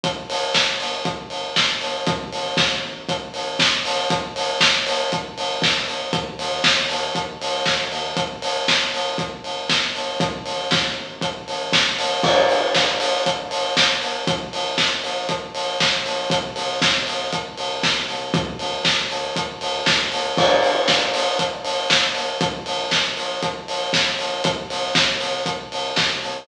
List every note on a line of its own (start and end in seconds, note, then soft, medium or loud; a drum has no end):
0.03 0.25 G1 medium
0.03 kick medium
0.03 closed hi-hat medium
0.29 0.51 G1 medium
0.29 open hi-hat medium
0.54 0.76 G1 medium
0.54 kick medium
0.54 snare medium
0.80 1.01 G1 medium
0.80 open hi-hat medium
1.05 1.27 G1 medium
1.05 kick medium
1.05 closed hi-hat medium
1.30 1.52 G1 medium
1.30 open hi-hat medium
1.56 1.78 G1 medium
1.56 kick medium
1.56 snare medium
1.81 2.03 G1 medium
1.81 open hi-hat medium
2.07 2.28 A1 medium
2.07 kick medium
2.07 closed hi-hat medium
2.32 2.54 A1 medium
2.32 open hi-hat medium
2.57 2.79 A1 medium
2.57 kick medium
2.57 snare medium
2.83 3.05 A1 medium
3.09 3.30 A1 medium
3.09 kick medium
3.09 closed hi-hat medium
3.34 3.56 A1 medium
3.34 open hi-hat medium
3.59 3.81 A1 medium
3.59 kick medium
3.59 snare medium
3.85 4.06 A1 medium
3.85 open hi-hat medium
4.10 4.32 G1 medium
4.10 kick medium
4.10 closed hi-hat medium
4.36 4.57 G1 medium
4.36 open hi-hat medium
4.60 4.83 G1 medium
4.60 kick medium
4.60 snare loud
4.87 5.08 G1 medium
4.87 open hi-hat medium
5.12 5.34 G1 medium
5.12 kick medium
5.12 closed hi-hat medium
5.37 5.59 G1 medium
5.37 open hi-hat medium
5.62 5.84 G1 medium
5.62 kick medium
5.62 snare medium
5.88 6.10 G1 medium
5.88 open hi-hat medium
6.13 6.35 D#2 medium
6.13 kick medium
6.13 closed hi-hat medium
6.39 6.61 D#2 medium
6.39 open hi-hat medium
6.64 6.86 D#2 medium
6.64 kick medium
6.64 snare medium
6.89 7.12 D#2 medium
6.89 open hi-hat medium
7.15 7.37 D#2 medium
7.15 kick medium
7.15 closed hi-hat medium
7.41 7.62 C#2 medium
7.41 open hi-hat medium
7.66 7.88 D#2 medium
7.66 kick medium
7.66 snare medium
7.92 8.13 D#2 medium
7.92 open hi-hat medium
8.17 8.39 G1 medium
8.17 kick medium
8.17 closed hi-hat medium
8.42 8.64 G1 medium
8.42 open hi-hat medium
8.68 8.90 G1 medium
8.68 kick medium
8.68 snare medium
8.93 9.15 G1 medium
8.93 open hi-hat medium
9.18 9.40 G1 medium
9.18 kick medium
9.18 closed hi-hat medium
9.44 9.66 G1 medium
9.44 open hi-hat medium
9.69 9.91 G1 medium
9.69 kick medium
9.69 snare medium
9.95 10.17 G1 medium
9.95 open hi-hat medium
10.20 10.42 A1 medium
10.20 kick medium
10.20 closed hi-hat medium
10.46 10.67 A1 medium
10.46 open hi-hat medium
10.71 10.93 A1 medium
10.71 kick medium
10.71 snare medium
10.97 11.18 A1 medium
11.21 11.44 A1 medium
11.21 kick medium
11.21 closed hi-hat medium
11.48 11.69 A1 medium
11.48 open hi-hat medium
11.72 11.95 A1 medium
11.72 kick medium
11.72 snare medium
11.98 12.20 A1 medium
11.98 open hi-hat medium
12.23 12.45 G1 medium
12.23 kick medium
12.23 crash medium
12.49 12.71 G#1 medium
12.49 open hi-hat medium
12.74 12.96 G1 medium
12.74 kick medium
12.74 snare medium
13.00 13.22 G1 medium
13.00 open hi-hat medium
13.26 13.47 G1 medium
13.26 kick medium
13.26 closed hi-hat medium
13.51 13.73 G1 medium
13.51 open hi-hat medium
13.76 13.98 G1 medium
13.76 kick medium
13.76 snare medium
14.02 14.23 G1 medium
14.02 open hi-hat medium
14.27 14.49 A#1 medium
14.27 kick medium
14.27 closed hi-hat medium
14.53 14.74 A#1 medium
14.53 open hi-hat medium
14.78 15.00 A#1 medium
14.78 kick medium
14.78 snare medium
15.03 15.25 A#1 medium
15.03 open hi-hat medium
15.29 15.51 A#1 medium
15.29 kick medium
15.29 closed hi-hat medium
15.54 15.76 A#1 medium
15.54 open hi-hat medium
15.80 16.01 A#1 medium
15.80 kick medium
15.80 snare medium
16.05 16.27 A#1 medium
16.05 open hi-hat medium
16.30 16.52 C2 medium
16.30 kick medium
16.30 closed hi-hat loud
16.56 16.78 C2 medium
16.56 open hi-hat medium
16.81 17.03 C2 medium
16.81 kick medium
16.81 snare medium
17.07 17.28 C2 medium
17.07 open hi-hat medium
17.32 17.54 C2 medium
17.32 kick medium
17.32 closed hi-hat medium
17.57 17.79 C2 medium
17.57 open hi-hat medium
17.83 18.05 C2 medium
17.83 kick medium
17.83 snare medium
18.08 18.30 C2 medium
18.08 open hi-hat medium
18.34 18.56 D2 medium
18.34 kick loud
18.34 closed hi-hat medium
18.59 18.81 D2 medium
18.59 open hi-hat medium
18.85 19.06 D2 medium
18.85 kick medium
18.85 snare medium
19.10 19.32 D2 medium
19.10 open hi-hat medium
19.36 19.57 D2 medium
19.36 kick medium
19.36 closed hi-hat medium
19.61 19.83 D2 medium
19.61 open hi-hat medium
19.86 20.08 D2 medium
19.86 kick medium
19.86 snare medium
20.12 20.34 D2 medium
20.12 open hi-hat medium
20.37 20.59 G1 medium
20.37 kick medium
20.37 crash medium
20.63 20.84 G#1 medium
20.63 open hi-hat medium
20.88 21.10 G1 medium
20.88 kick medium
20.88 snare medium
21.14 21.35 G1 medium
21.14 open hi-hat medium
21.39 21.61 G1 medium
21.39 kick medium
21.39 closed hi-hat medium
21.65 21.86 G1 medium
21.65 open hi-hat medium
21.90 22.12 G1 medium
21.90 kick medium
21.90 snare medium
22.15 22.37 G1 medium
22.15 open hi-hat medium
22.41 22.62 A#1 medium
22.41 kick medium
22.41 closed hi-hat medium
22.66 22.88 A#1 medium
22.66 open hi-hat medium
22.91 23.13 A#1 medium
22.91 kick medium
22.91 snare medium
23.17 23.39 A#1 medium
23.17 open hi-hat medium
23.42 23.64 A#1 medium
23.42 kick medium
23.42 closed hi-hat medium
23.68 23.90 A#1 medium
23.68 open hi-hat medium
23.93 24.15 A#1 medium
23.93 kick medium
23.93 snare medium
24.19 24.40 A#1 medium
24.19 open hi-hat medium
24.44 24.66 C2 medium
24.44 kick medium
24.44 closed hi-hat loud
24.70 24.91 C2 medium
24.70 open hi-hat medium
24.95 25.17 C2 medium
24.95 kick medium
24.95 snare medium
25.20 25.42 C2 medium
25.20 open hi-hat medium
25.46 25.67 C2 medium
25.46 kick medium
25.46 closed hi-hat medium
25.71 25.93 C2 medium
25.71 open hi-hat medium
25.96 26.18 C2 medium
25.96 kick medium
25.96 snare medium
26.22 26.44 C2 medium
26.22 open hi-hat medium